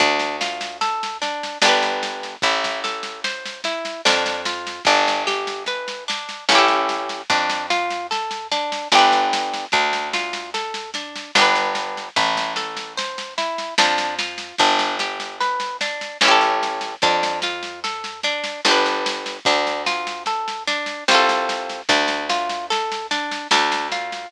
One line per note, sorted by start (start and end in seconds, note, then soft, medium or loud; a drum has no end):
0.00 1.49 D2 loud
0.00 0.36 D4 medium
0.00 kick loud
0.00 snare medium
0.19 snare medium
0.41 0.77 F4 medium
0.41 snare medium
0.61 snare medium
0.81 1.18 A4 medium
0.81 snare medium
1.03 snare medium
1.22 1.58 D4 medium
1.22 snare medium
1.43 snare medium
1.62 2.37 G1 loud
1.62 2.35 D4 medium
1.62 2.35 G4 medium
1.62 snare loud
1.68 2.35 B4 medium
1.82 snare medium
2.03 snare medium
2.23 snare medium
2.42 3.92 A1 loud
2.42 2.80 E4 loud
2.42 kick loud
2.42 snare medium
2.64 kick medium
2.64 snare medium
2.84 3.20 A4 medium
2.84 snare medium
3.03 snare medium
3.24 3.61 C5 medium
3.24 snare medium
3.45 snare medium
3.64 4.01 E4 medium
3.64 snare medium
3.85 snare medium
4.05 4.80 F2 loud
4.05 4.42 D4 medium
4.05 snare loud
4.26 snare medium
4.45 4.83 F4 medium
4.45 snare medium
4.67 snare medium
4.85 6.36 G1 loud
4.85 5.23 D4 loud
4.85 kick medium
4.85 snare medium
5.08 snare medium
5.27 5.64 G4 medium
5.27 snare medium
5.47 snare medium
5.66 6.04 B4 medium
5.66 snare medium
5.88 snare medium
6.08 6.45 D4 medium
6.08 snare medium
6.29 snare medium
6.49 7.23 A1 loud
6.49 7.22 C#4 medium
6.49 7.22 E4 loud
6.49 snare loud
6.55 7.22 G4 loud
6.55 7.22 A4 medium
6.68 snare medium
6.89 snare medium
7.09 snare medium
7.30 8.79 F2 loud
7.30 7.66 D4 loud
7.30 kick loud
7.30 snare medium
7.49 snare medium
7.70 8.07 F4 medium
7.70 snare medium
7.91 snare medium
8.11 8.47 A4 medium
8.11 snare medium
8.31 snare medium
8.52 8.88 D4 medium
8.52 snare medium
8.72 snare medium
8.92 9.67 G1 loud
8.92 9.65 D4 loud
8.92 9.65 G4 loud
8.92 snare loud
8.98 9.65 B4 loud
9.12 snare medium
9.33 snare medium
9.54 snare medium
9.72 11.22 D2 loud
9.72 10.09 D4 medium
9.72 kick loud
9.72 snare medium
9.93 snare medium
10.14 10.50 F4 medium
10.14 snare medium
10.33 snare medium
10.54 10.91 A4 medium
10.54 snare medium
10.74 snare medium
10.94 11.31 D4 medium
10.94 snare medium
11.16 snare medium
11.35 12.10 G1 loud
11.35 12.08 D4 medium
11.35 12.08 G4 medium
11.35 snare loud
11.42 12.08 B4 medium
11.55 snare medium
11.75 snare medium
11.97 snare medium
12.16 13.65 A1 loud
12.16 12.53 E4 loud
12.16 kick loud
12.16 snare medium
12.35 kick medium
12.35 snare medium
12.56 12.93 A4 medium
12.56 snare medium
12.77 snare medium
12.97 13.34 C5 medium
12.97 snare medium
13.18 snare medium
13.38 13.74 E4 medium
13.38 snare medium
13.58 snare medium
13.78 14.53 F2 loud
13.78 14.15 D4 medium
13.78 snare loud
13.98 snare medium
14.19 14.55 F4 medium
14.19 snare medium
14.38 snare medium
14.58 16.09 G1 loud
14.58 14.96 D4 loud
14.58 kick medium
14.58 snare medium
14.79 snare medium
14.99 15.36 G4 medium
14.99 snare medium
15.20 snare medium
15.41 15.77 B4 medium
15.41 snare medium
15.60 snare medium
15.81 16.18 D4 medium
15.81 snare medium
16.01 snare medium
16.21 16.96 A1 loud
16.21 16.95 C#4 medium
16.21 16.95 E4 loud
16.21 snare loud
16.28 16.95 G4 loud
16.28 16.95 A4 medium
16.41 snare medium
16.63 snare medium
16.81 snare medium
17.02 18.52 F2 loud
17.02 17.39 D4 loud
17.02 kick loud
17.02 snare medium
17.23 snare medium
17.42 17.80 F4 medium
17.42 snare medium
17.63 snare medium
17.84 18.20 A4 medium
17.84 snare medium
18.04 snare medium
18.23 18.61 D4 medium
18.23 snare medium
18.44 snare medium
18.65 19.40 G1 loud
18.65 19.38 D4 loud
18.65 19.38 G4 loud
18.65 snare loud
18.71 19.38 B4 loud
18.86 snare medium
19.06 snare medium
19.26 snare medium
19.45 20.95 D2 loud
19.45 19.83 D4 loud
19.45 kick loud
19.45 snare medium
19.67 snare medium
19.86 20.23 F4 medium
19.86 snare medium
20.07 snare medium
20.26 20.63 A4 medium
20.26 snare medium
20.48 snare medium
20.67 21.04 D4 medium
20.67 snare medium
20.86 snare medium
21.08 21.83 C2 loud
21.08 21.81 C4 medium
21.08 21.81 F4 loud
21.08 snare loud
21.15 21.81 A4 loud
21.29 snare medium
21.49 snare medium
21.69 snare medium
21.89 23.38 D2 loud
21.89 22.26 D4 loud
21.89 kick loud
21.89 snare medium
22.08 snare medium
22.30 22.66 F4 medium
22.30 snare medium
22.49 snare medium
22.70 23.07 A4 medium
22.70 snare medium
22.92 snare medium
23.11 23.47 D4 medium
23.11 snare medium
23.31 snare medium
23.51 24.26 D2 loud
23.51 23.88 D4 loud
23.51 snare loud
23.72 snare medium
23.92 24.28 F4 medium
23.92 snare medium
24.12 snare medium